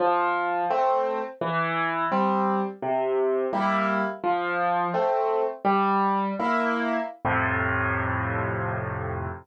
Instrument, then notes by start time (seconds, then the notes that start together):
acoustic grand piano
0.00 F3
0.70 A3 C4
1.41 E3
2.12 G3 C4
2.82 C3
3.53 G3 A#3 E4
4.24 F3
4.94 A3 C4
5.65 G3
6.39 A#3 E4
7.25 F2 A2 C3